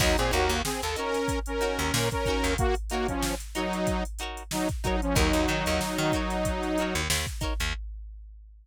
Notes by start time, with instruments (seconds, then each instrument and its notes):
0.00 electric bass (finger) D#2, lead 2 (sawtooth) F#3 D#4, acoustic guitar (steel) D#4 F#4 A#4 C#5, kick, crash
0.18 electric bass (finger) A#2, lead 2 (sawtooth) C4 G#4, closed hi-hat
0.31 electric bass (finger) D#2, lead 2 (sawtooth) A#3 F#4, acoustic guitar (steel) D#4 F#4 A#4 C#5, closed hi-hat
0.49 electric bass (finger) D#2, closed hi-hat
0.65 lead 2 (sawtooth) C4 G#4, snare
0.82 electric bass (finger) D#2, lead 2 (sawtooth) A4, closed hi-hat
0.96 lead 2 (sawtooth) C#4 A#4, acoustic guitar (steel) D#4 F#4 A#4 C#5, closed hi-hat
1.14 snare, closed hi-hat
1.28 kick, closed hi-hat
1.46 lead 2 (sawtooth) C#4 A#4, closed hi-hat
1.61 acoustic guitar (steel) D#4 F#4 A#4 C#5, closed hi-hat
1.79 electric bass (finger) D#2, closed hi-hat
1.94 electric bass (finger) A#2, snare
2.11 lead 2 (sawtooth) C#4 A#4, kick, closed hi-hat
2.26 acoustic guitar (steel) D#4 F#4 A#4, kick, closed hi-hat
2.30 acoustic guitar (steel) C#5
2.44 electric bass (finger) D#2, closed hi-hat
2.58 lead 2 (sawtooth) A#3 F#4, kick, closed hi-hat
2.75 closed hi-hat
2.90 lead 2 (sawtooth) A#3 F#4, acoustic guitar (steel) D#4 F#4 A#4, snare, closed hi-hat
2.94 acoustic guitar (steel) C#5
3.08 lead 2 (sawtooth) F3 C#4, kick, closed hi-hat
3.22 snare
3.40 closed hi-hat
3.55 lead 2 (sawtooth) F#3 D#4, acoustic guitar (steel) D#4 F#4 A#4 C#5, snare, closed hi-hat
3.73 closed hi-hat
3.87 kick, closed hi-hat
4.05 closed hi-hat
4.19 acoustic guitar (steel) D#4 F#4 A#4, closed hi-hat
4.23 acoustic guitar (steel) C#5
4.37 closed hi-hat
4.51 lead 2 (sawtooth) F#3 D#4, snare
4.69 kick, closed hi-hat
4.84 lead 2 (sawtooth) F#3 D#4, acoustic guitar (steel) D#4 F#4 A#4 C#5, kick, closed hi-hat
5.02 lead 2 (sawtooth) F3 C#4, closed hi-hat
5.15 electric bass (finger) D#2, lead 2 (sawtooth) F#3 D#4, acoustic guitar (steel) D#4 F#4 A#4 C#5, kick, closed hi-hat
5.33 electric bass (finger) D#2, closed hi-hat
5.48 electric bass (finger) D#3, acoustic guitar (steel) D#4 F#4 A#4 C#5, closed hi-hat
5.66 electric bass (finger) D#2, closed hi-hat
5.81 snare
5.98 electric bass (finger) D#3, closed hi-hat
6.12 acoustic guitar (steel) D#4 F#4 A#4, kick, closed hi-hat
6.16 acoustic guitar (steel) C#5
6.30 snare, closed hi-hat
6.45 kick, closed hi-hat
6.63 snare, closed hi-hat
6.78 acoustic guitar (steel) D#4 F#4 A#4, closed hi-hat
6.82 acoustic guitar (steel) C#5
6.95 electric bass (finger) D#2, closed hi-hat
7.10 electric bass (finger) D#2, snare
7.26 kick, snare, closed hi-hat
7.41 acoustic guitar (steel) D#4 F#4 A#4 C#5, kick, closed hi-hat
7.60 electric bass (finger) D#2, closed hi-hat